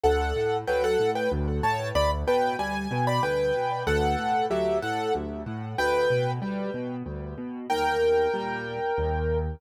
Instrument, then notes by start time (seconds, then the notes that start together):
acoustic grand piano
0.03 D2 A4 F#5
0.36 A2
0.67 F#3 B4 G5
0.84 A4 F#5
0.99 A2
1.15 B4 G5
1.32 D2
1.63 A2 C#5 A5
1.95 D2 D5 B5
2.27 B2 B4 G5
2.59 G3 G#5
2.91 B2
3.07 D5 B5
3.23 D2 B4 G5
3.55 B2
3.87 D2 A4 F#5
4.18 A2
4.50 F#3 G4 E5
4.82 A2 A4 F#5
5.15 D2
5.46 A2
5.78 D2 B4 G5
6.10 B2
6.42 G3
6.74 B2
7.06 D2
7.38 B2
7.70 D#2 A#4 G5
8.34 A#2 G3
8.98 D#2